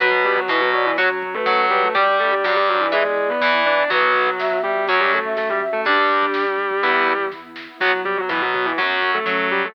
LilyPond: <<
  \new Staff \with { instrumentName = "Distortion Guitar" } { \time 4/4 \key b \minor \tempo 4 = 123 <fis fis'>8 <g g'>16 <fis fis'>16 <e e'>16 <fis fis'>16 <fis fis'>16 <e e'>16 <fis fis'>8. <a a'>8. <g g'>16 <a a'>16 | <g g'>8 <a a'>16 <g g'>16 <fis fis'>16 <g g'>16 <fis fis'>16 <e e'>16 <gis gis'>8. <b b'>8. <d' d''>16 <d' d''>16 | <fis fis'>4. <g g'>8 <fis fis'>16 <g g'>16 <a a'>8 <a a'>16 <g g'>16 r16 <a a'>16 | <g g'>2. r4 |
<fis fis'>8 <g g'>16 <fis fis'>16 <e e'>16 <fis fis'>16 <fis fis'>16 <e e'>16 <fis fis'>8. <a a'>8. <g g'>16 <a a'>16 | }
  \new Staff \with { instrumentName = "Flute" } { \time 4/4 \key b \minor fis'4 b'8 d''8 r8. b'8. b'8 | d''1 | b'4 e''8 e''8 r8. e''8. e''8 | d'4. r2 r8 |
fis4. r8 fis4 cis'4 | }
  \new Staff \with { instrumentName = "Overdriven Guitar" } { \time 4/4 \key b \minor <fis' b'>4 b,4 <fis' cis''>16 r8. fis4 | <g' d''>4 g,4 <b' e''>16 r8. e4 | <fis b>4 r4 <fis cis'>8. r4 r16 | <g d'>4 r4 <b e'>8. r4 r16 |
<fis b>16 r8. b,4 <fis cis'>4 fis4 | }
  \new Staff \with { instrumentName = "Synth Bass 1" } { \clef bass \time 4/4 \key b \minor b,,4 b,,4 fis,4 fis,4 | g,,4 g,,4 e,4 e,4 | b,,2 fis,2 | g,,2 e,2 |
b,,4 b,,4 fis,4 fis,4 | }
  \new Staff \with { instrumentName = "Pad 2 (warm)" } { \time 4/4 \key b \minor <b fis'>2 <cis' fis'>2 | <d' g'>2 <b e'>2 | <b fis'>2 <cis' fis'>2 | <d' g'>2 <b e'>2 |
<b fis'>2 <cis' fis'>2 | }
  \new DrumStaff \with { instrumentName = "Drums" } \drummode { \time 4/4 <hh bd>16 bd16 <hh bd>16 bd16 <bd sn>16 bd16 <hh bd>16 bd16 <hh bd>16 bd16 <hh bd>16 bd16 <bd sn>16 bd16 <hh bd>16 bd16 | <hh bd>16 bd16 <hh bd>16 bd16 <bd sn>16 bd16 <hh bd>16 bd16 <hh bd>16 bd16 <hh bd>16 bd16 sn16 bd16 <hh bd>16 bd16 | <hh bd>16 bd16 <hh bd>16 bd16 <bd sn>16 bd16 <hh bd>16 bd16 <hh bd>16 bd16 <hh bd>16 bd16 <bd sn>16 bd16 <hh bd>16 bd16 | <hh bd>16 bd16 <hh bd>16 bd16 <bd sn>16 bd16 <hh bd>16 bd16 <hh bd>16 bd16 <hh bd>16 bd16 <bd sn>8 sn8 |
<cymc bd>16 bd16 <hh bd>16 bd16 <bd sn>16 bd16 <hh bd>16 bd16 <hh bd>16 bd16 <hh bd>16 bd16 <bd sn>16 bd16 <hh bd>16 bd16 | }
>>